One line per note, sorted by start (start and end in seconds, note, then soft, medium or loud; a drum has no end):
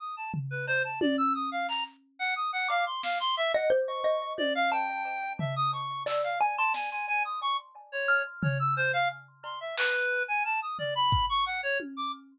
0.00 0.15 D#6 medium
0.17 0.32 A5 soft
0.34 floor tom medium
0.51 0.66 B4 medium
0.67 0.82 C5 loud
0.67 cowbell medium
0.84 0.99 A5 medium
1.01 1.16 D5 medium
1.01 high tom loud
1.18 1.33 E6 loud
1.35 1.50 D#6 medium
1.52 1.67 F5 medium
1.69 1.84 A#5 medium
1.69 clap medium
2.19 2.34 F#5 loud
2.36 2.51 D#6 medium
2.53 2.68 F#5 medium
2.69 2.85 F5 loud
2.69 2.99 D6 medium
2.69 cowbell medium
2.87 3.02 C6 medium
3.03 3.18 F5 medium
3.03 snare medium
3.20 3.35 C6 loud
3.37 3.52 E5 loud
3.54 3.70 D#5 loud
3.54 3.69 F#5 medium
3.70 4.00 C5 loud
3.87 4.33 C#6 medium
4.04 4.65 D#5 medium
4.38 4.53 D5 loud
4.38 high tom medium
4.55 4.70 F5 loud
4.72 5.33 G5 medium
4.72 5.02 A5 medium
5.39 5.55 E5 medium
5.39 floor tom medium
5.56 5.71 D#6 loud
5.73 6.03 C#6 medium
6.06 6.37 D5 medium
6.06 6.22 E6 medium
6.06 clap medium
6.24 6.39 F5 medium
6.40 6.56 G#5 medium
6.40 6.56 G#5 loud
6.57 6.73 A5 loud
6.57 6.74 C6 medium
6.74 6.89 G#5 medium
6.74 snare medium
6.91 7.06 G#5 medium
7.08 7.23 G#5 loud
7.25 7.40 D#6 medium
7.42 7.57 C#6 loud
7.92 8.22 C#5 medium
8.08 8.99 F6 medium
8.43 8.58 C#5 medium
8.43 floor tom loud
8.59 8.75 E6 loud
8.77 8.92 C5 loud
8.93 9.08 F5 loud
9.44 9.59 C6 soft
9.44 cowbell medium
9.61 9.76 E5 medium
9.77 10.23 B4 loud
9.77 clap loud
10.28 10.43 G#5 loud
10.45 10.60 A5 medium
10.62 10.77 D#6 medium
10.79 10.94 D5 medium
10.79 floor tom medium
10.95 11.26 B5 loud
11.12 kick medium
11.29 11.45 C#6 loud
11.46 11.61 F#5 medium
11.63 11.78 C#5 medium
11.80 high tom medium
11.97 12.12 D6 medium